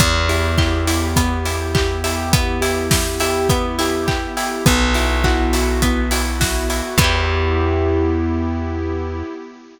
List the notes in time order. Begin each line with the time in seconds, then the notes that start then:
0.00 E2 B3 E4 G4, kick, closed hi-hat
0.29 E4 G4, open hi-hat
0.58 E4 G4, kick, clap
0.86 E4 G4, open hi-hat
1.16 B3, kick, closed hi-hat
1.45 E4 G4, open hi-hat
1.74 E4 G4, kick, clap
2.04 E4 G4, open hi-hat
2.31 B3, kick, closed hi-hat
2.61 E4 G4, open hi-hat
2.91 E4 G4, kick, snare
3.20 E4 G4, open hi-hat
3.49 B3, kick, closed hi-hat
3.79 E4 G4, open hi-hat
4.06 E4 G4, kick, clap
4.37 E4 G4, open hi-hat
4.66 B1 B3 E4 F#4, kick, closed hi-hat
4.94 E4 F#4, open hi-hat
5.24 E4 F#4, kick, clap
5.53 E4 F#4, open hi-hat
5.82 B3, kick, closed hi-hat
6.11 E4 F#4, open hi-hat
6.40 E4 F#4, kick, snare
6.69 E4 F#4, open hi-hat
6.98 E2 B3 E4 G4, kick, crash
7.04 G4